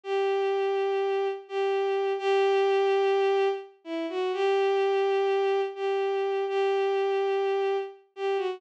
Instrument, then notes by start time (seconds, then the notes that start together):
violin
0.03 G4
1.48 G4
2.18 G4
3.84 E4
4.09 F#4
4.33 G4
5.75 G4
6.48 G4
8.16 G4
8.37 F#4